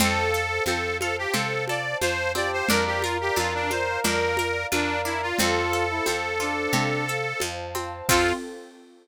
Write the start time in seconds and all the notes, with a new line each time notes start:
0.00 F2 C4 A4 C5 F5 A5, low conga, shaker
0.34 A4, shaker
0.66 F2 C4 A4, high conga, shaker
1.00 F4 A4, high conga, shaker
1.18 G4
1.34 C3 C4 A4, low conga, shaker
1.68 A4 D5, high conga, shaker
2.01 F2 F4 C5, high conga, shaker
2.35 C4 G4 D5, high conga, shaker
2.53 C5
2.68 F2 D4 A#4 D5 F5 A#5, low conga, shaker
2.86 G4
3.02 F4 A#4, high conga, shaker
3.21 G4
3.36 F2 D4 F4, high conga, shaker
3.55 D4
3.71 F4 C5, high conga, shaker
4.04 F2 D4 A#4, low conga, shaker
4.37 A#4, high conga, shaker
4.71 F2 D4 F4 A#4, high conga, shaker
5.05 D4 E4, shaker
5.22 F4
5.38 F2 C4 F4 A4 C5 F5 A5, low conga, shaker
5.73 A4, shaker
5.91 E4
6.06 F2 C4, high conga, shaker
6.40 D4 F4, shaker
6.73 C3 C4, low conga, shaker
7.08 A4, shaker
7.40 F2 F4, high conga, shaker
7.75 C4, high conga, shaker
8.09 F2 C4 F4 A4, kick, crash